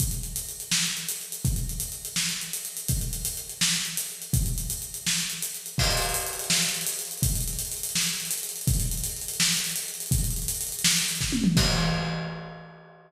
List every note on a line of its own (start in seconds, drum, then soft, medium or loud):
0.00 kick medium
0.00 closed hi-hat medium
0.11 closed hi-hat medium
0.23 closed hi-hat medium
0.36 closed hi-hat medium
0.49 closed hi-hat medium
0.60 closed hi-hat medium
0.71 snare medium
0.84 closed hi-hat medium
0.97 closed hi-hat medium
1.09 closed hi-hat medium
1.21 closed hi-hat medium
1.32 closed hi-hat medium
1.45 kick medium
1.45 closed hi-hat medium
1.56 closed hi-hat medium
1.69 closed hi-hat medium
1.80 closed hi-hat medium
1.92 closed hi-hat medium
2.05 closed hi-hat medium
2.16 snare medium
2.29 closed hi-hat medium
2.41 closed hi-hat medium
2.53 closed hi-hat medium
2.65 closed hi-hat medium
2.77 closed hi-hat medium
2.88 kick medium
2.88 closed hi-hat medium
3.01 closed hi-hat medium
3.13 closed hi-hat medium
3.25 closed hi-hat medium
3.37 closed hi-hat medium
3.49 closed hi-hat medium
3.61 snare loud
3.73 closed hi-hat medium
3.85 closed hi-hat medium
3.97 closed hi-hat medium
4.09 closed hi-hat medium
4.22 closed hi-hat medium
4.33 kick loud
4.33 closed hi-hat medium
4.46 closed hi-hat medium
4.58 closed hi-hat medium
4.70 closed hi-hat medium
4.82 closed hi-hat medium
4.94 closed hi-hat medium
5.07 snare medium
5.18 closed hi-hat medium
5.30 closed hi-hat medium
5.42 closed hi-hat medium
5.54 closed hi-hat medium
5.66 closed hi-hat medium
5.78 kick medium
5.78 crash medium
5.84 closed hi-hat medium
5.91 closed hi-hat medium
5.97 closed hi-hat medium
6.02 closed hi-hat medium
6.09 closed hi-hat medium
6.14 closed hi-hat medium
6.20 closed hi-hat medium
6.27 closed hi-hat medium
6.33 closed hi-hat medium
6.39 closed hi-hat medium
6.44 closed hi-hat medium
6.50 snare loud
6.57 closed hi-hat medium
6.62 closed hi-hat medium
6.69 closed hi-hat medium
6.74 closed hi-hat medium
6.81 closed hi-hat medium
6.87 closed hi-hat medium
6.93 closed hi-hat medium
6.99 closed hi-hat medium
7.05 closed hi-hat medium
7.11 closed hi-hat medium
7.18 closed hi-hat medium
7.22 kick medium
7.22 closed hi-hat loud
7.29 closed hi-hat medium
7.35 closed hi-hat medium
7.41 closed hi-hat medium
7.48 closed hi-hat medium
7.53 closed hi-hat medium
7.59 closed hi-hat medium
7.65 closed hi-hat medium
7.72 closed hi-hat medium
7.77 closed hi-hat medium
7.83 closed hi-hat medium
7.89 closed hi-hat medium
7.95 snare medium
8.01 closed hi-hat medium
8.07 closed hi-hat medium
8.14 closed hi-hat medium
8.20 closed hi-hat medium
8.25 closed hi-hat medium
8.31 closed hi-hat medium
8.38 closed hi-hat medium
8.43 closed hi-hat medium
8.49 closed hi-hat medium
8.56 closed hi-hat medium
8.61 closed hi-hat medium
8.67 kick loud
8.67 closed hi-hat medium
8.74 closed hi-hat medium
8.80 closed hi-hat medium
8.86 closed hi-hat medium
8.91 closed hi-hat medium
8.97 closed hi-hat medium
9.04 closed hi-hat medium
9.10 closed hi-hat medium
9.16 closed hi-hat medium
9.21 closed hi-hat medium
9.28 closed hi-hat medium
9.34 closed hi-hat medium
9.40 snare loud
9.45 closed hi-hat medium
9.52 closed hi-hat medium
9.57 closed hi-hat medium
9.64 closed hi-hat medium
9.70 closed hi-hat medium
9.76 closed hi-hat medium
9.82 closed hi-hat medium
9.88 closed hi-hat medium
9.94 closed hi-hat medium
10.00 closed hi-hat medium
10.06 closed hi-hat medium
10.11 kick loud
10.11 closed hi-hat medium
10.18 closed hi-hat medium
10.24 closed hi-hat medium
10.31 closed hi-hat medium
10.36 closed hi-hat medium
10.42 closed hi-hat medium
10.48 closed hi-hat medium
10.55 closed hi-hat medium
10.61 closed hi-hat medium
10.67 closed hi-hat medium
10.72 closed hi-hat medium
10.79 closed hi-hat medium
10.84 snare loud
10.91 closed hi-hat medium
10.96 closed hi-hat medium
11.02 closed hi-hat medium
11.08 closed hi-hat medium
11.15 closed hi-hat medium
11.21 kick medium
11.21 snare medium
11.32 high tom medium
11.44 mid tom loud
11.57 kick loud
11.57 crash loud